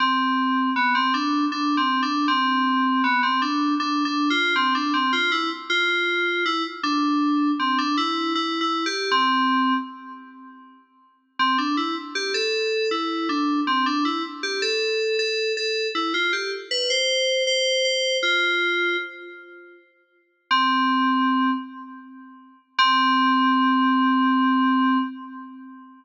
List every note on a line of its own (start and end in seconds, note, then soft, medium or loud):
0.00 0.70 C4 medium
0.76 0.94 B3 medium
0.95 1.13 C4 medium
1.14 1.45 D4 medium
1.52 1.76 D4 medium
1.77 2.01 C4 medium
2.03 2.27 D4 medium
2.28 3.02 C4 medium
3.04 3.22 B3 medium
3.23 3.41 C4 medium
3.42 3.74 D4 medium
3.80 4.04 D4 medium
4.05 4.29 D4 medium
4.30 4.54 F4 medium
4.56 4.74 C4 medium
4.75 4.93 D4 medium
4.94 5.12 C4 medium
5.13 5.31 F4 medium
5.32 5.50 E4 medium
5.70 6.44 F4 medium
6.46 6.64 E4 medium
6.83 7.51 D4 medium
7.59 7.78 C4 medium
7.78 7.97 D4 medium
7.97 8.33 E4 medium
8.35 8.59 E4 medium
8.61 8.85 E4 medium
8.86 9.10 G4 medium
9.11 9.74 C4 medium
11.39 11.57 C4 medium
11.58 11.76 D4 medium
11.77 11.95 E4 medium
12.15 12.33 G4 medium
12.34 12.90 A4 medium
12.91 13.28 E4 medium
13.29 13.60 D4 medium
13.67 13.85 C4 medium
13.86 14.04 D4 medium
14.05 14.23 E4 medium
14.43 14.61 G4 medium
14.62 15.17 A4 medium
15.19 15.52 A4 medium
15.57 15.88 A4 medium
15.95 16.13 E4 medium
16.14 16.32 F4 medium
16.33 16.51 G4 medium
16.71 16.89 B4 medium
16.90 17.43 C5 medium
17.47 17.84 C5 medium
17.85 18.17 C5 medium
18.23 18.97 F4 medium
20.51 21.51 C4 medium
22.78 24.98 C4 loud